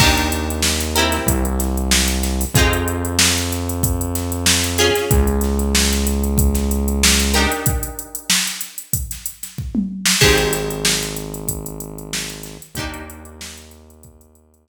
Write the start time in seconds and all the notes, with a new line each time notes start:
0.00 D#2 D4 D#4 G4 A#4, kick, crash
0.17 closed hi-hat
0.32 closed hi-hat
0.50 closed hi-hat
0.62 snare
0.81 closed hi-hat
0.95 C4 E4 G4 A#4, closed hi-hat
1.12 snare, closed hi-hat
1.26 C2, kick, closed hi-hat
1.45 closed hi-hat
1.59 snare, closed hi-hat
1.77 closed hi-hat
1.91 snare
2.08 closed hi-hat
2.23 snare, closed hi-hat
2.41 open hi-hat
2.54 F2 D#4 F4 G#4, kick, closed hi-hat
2.59 C4
2.73 closed hi-hat
2.88 closed hi-hat
3.05 closed hi-hat
3.19 snare
3.36 snare, closed hi-hat
3.50 snare, closed hi-hat
3.69 closed hi-hat
3.83 kick, closed hi-hat
4.01 closed hi-hat
4.15 snare, closed hi-hat
4.32 closed hi-hat
4.46 snare
4.64 closed hi-hat
4.78 C#4 F4 G#4, snare, closed hi-hat
4.95 snare, closed hi-hat
5.11 C#2, kick, closed hi-hat
5.27 closed hi-hat
5.41 snare, closed hi-hat
5.59 closed hi-hat
5.75 snare
5.93 snare, closed hi-hat
6.07 closed hi-hat
6.24 closed hi-hat
6.38 kick, closed hi-hat
6.55 snare, closed hi-hat
6.71 closed hi-hat
6.88 closed hi-hat
7.03 snare
7.20 closed hi-hat
7.34 D4 D#4 G4 A#4, snare, closed hi-hat
7.52 closed hi-hat
7.66 kick, closed hi-hat
7.83 closed hi-hat
7.99 closed hi-hat
8.15 closed hi-hat
8.30 snare
8.47 closed hi-hat
8.61 closed hi-hat
8.78 closed hi-hat
8.93 kick, closed hi-hat
9.11 snare, closed hi-hat
9.26 closed hi-hat
9.43 snare, closed hi-hat
9.58 kick
9.75 mid tom
10.06 snare
10.21 G#1 C4 D#4 G4 G#4, kick, crash
10.38 closed hi-hat
10.53 snare, closed hi-hat
10.70 closed hi-hat
10.85 snare
11.03 closed hi-hat
11.16 closed hi-hat
11.34 closed hi-hat
11.48 kick, closed hi-hat
11.66 closed hi-hat
11.80 closed hi-hat
11.98 closed hi-hat
12.13 snare
12.30 closed hi-hat
12.43 snare, closed hi-hat
12.62 closed hi-hat
12.75 D#2 D4 D#4 G4, kick, closed hi-hat
12.80 A#3
12.94 closed hi-hat
13.10 closed hi-hat
13.25 closed hi-hat
13.41 snare
13.58 closed hi-hat
13.71 closed hi-hat
13.90 closed hi-hat
14.03 kick, closed hi-hat
14.21 closed hi-hat
14.35 closed hi-hat
14.54 closed hi-hat
14.68 snare